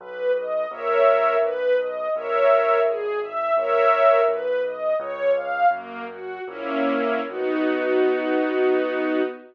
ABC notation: X:1
M:2/4
L:1/8
Q:1/4=84
K:B
V:1 name="String Ensemble 1"
B d [Ace]2 | B d [Ace]2 | G e [Ace]2 | B d c ^e |
"^rit." A, F [A,CE]2 | [B,DF]4 |]
V:2 name="Acoustic Grand Piano" clef=bass
B,,,2 A,,,2 | B,,,2 A,,,2 | G,,,2 A,,,2 | B,,,2 C,,2 |
"^rit." F,,2 A,,,2 | B,,,4 |]